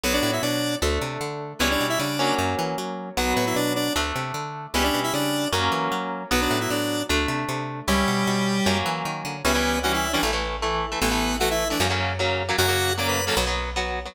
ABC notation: X:1
M:4/4
L:1/16
Q:1/4=153
K:Bm
V:1 name="Lead 1 (square)"
[B,B] [Dd]2 [Ee] [Dd]4 z8 | [B,B] [Dd]2 [Ee] [Dd]4 z8 | [B,B]2 [B,B] [Ee] [Dd]2 [Dd]2 z8 | [B,B] [Dd]2 [Ee] [Dd]4 z8 |
[B,B] [Dd]2 [Ee] [Dd]4 z8 | [G,G]10 z6 | [B,B]4 [Ff] [Ee]2 [Dd] z8 | [B,B]4 [Ff] [Ee]2 [Dd] z8 |
[Ff]4 [dd'] [Bb]2 [Aa] z8 |]
V:2 name="Overdriven Guitar"
[F,B,]8 [A,D]8 | [G,CE]6 [F,^A,C]10 | [F,B,]8 [A,D]8 | [G,CE]8 [F,^A,C]8 |
[F,B,]8 [A,D]8 | [G,CE]8 [F,^A,C]8 | [E,G,C] [E,G,C]3 [E,G,C]3 [E,G,C] [E,A,] [E,A,]3 [E,A,]3 [E,A,] | [E,A,] [E,A,]3 [E,A,]3 [E,A,] [C,F,^A,] [C,F,A,]3 [C,F,A,]3 [C,F,A,] |
[C,F,^A,] [C,F,A,]3 [C,F,A,]3 [C,F,A,] [F,B,] [F,B,]3 [F,B,]3 [F,B,] |]
V:3 name="Electric Bass (finger)" clef=bass
B,,,2 A,,2 B,,4 D,,2 =C,2 D,4 | C,,2 B,,2 C,4 F,,2 E,2 F,4 | B,,,2 A,,2 B,,4 D,,2 =C,2 D,4 | C,,2 B,,2 C,4 F,,2 E,2 F,4 |
B,,,2 A,,2 A,,4 D,,2 =C,2 C,4 | C,,2 B,,2 B,,4 F,,2 E,2 ^D,2 =D,2 | C,,8 A,,,8 | A,,,8 F,,8 |
F,,8 B,,,8 |]